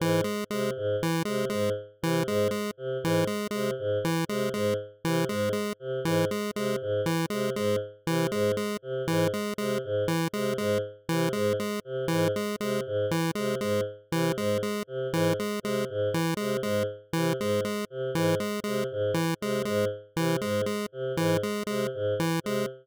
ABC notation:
X:1
M:9/8
L:1/8
Q:3/8=79
K:none
V:1 name="Choir Aahs" clef=bass
_A,, z C, A,, z C, A,, z C, | _A,, z C, A,, z C, A,, z C, | _A,, z C, A,, z C, A,, z C, | _A,, z C, A,, z C, A,, z C, |
_A,, z C, A,, z C, A,, z C, | _A,, z C, A,, z C, A,, z C, | _A,, z C, A,, z C, A,, z C, | _A,, z C, A,, z C, A,, z C, |
_A,, z C, A,, z C, A,, z C, | _A,, z C, A,, z C, A,, z C, |]
V:2 name="Lead 1 (square)" clef=bass
E, _A, A, z E, A, A, z E, | _A, A, z E, A, A, z E, A, | _A, z E, A, A, z E, A, A, | z E, _A, A, z E, A, A, z |
E, _A, A, z E, A, A, z E, | _A, A, z E, A, A, z E, A, | _A, z E, A, A, z E, A, A, | z E, _A, A, z E, A, A, z |
E, _A, A, z E, A, A, z E, | _A, A, z E, A, A, z E, A, |]